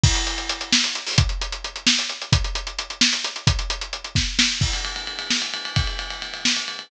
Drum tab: CC |x---------|----------|----------|----------|
RD |----------|----------|----------|----------|
HH |-xxxxx-xxo|xxxxxx-xxx|xxxxxx-xxx|xxxxxx----|
SD |------o---|------o---|------o---|------o-o-|
BD |o---------|o---------|o---------|o-----o---|

CC |x---------|----------|
RD |-xxxxx-xxx|xxxxxx-xxx|
HH |----------|----------|
SD |------o---|------o---|
BD |o---------|o---------|